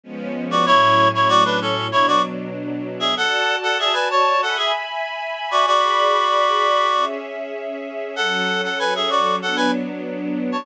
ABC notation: X:1
M:4/4
L:1/16
Q:1/4=96
K:F#m
V:1 name="Clarinet"
z3 [Fd] | [Ec]3 [Ec] [Fd] [DB] [CA]2 [Ec] [Fd] z5 [Ge] | [Af]3 [Af] [Ge] [Bg] [ca]2 [Af] [Ge] z5 [Fd] | [Fd]10 z6 |
[Af]3 [Af] [Bg] [Ge] [Fd]2 [Af] [Bg] z5 [ca] |]
V:2 name="String Ensemble 1"
[^E,G,B,C]4 | [A,,F,C]8 [B,,F,D]8 | [Fda]8 [egb]8 | [Gdb]8 [CGe]8 |
[F,CA]8 [F,B,D]8 |]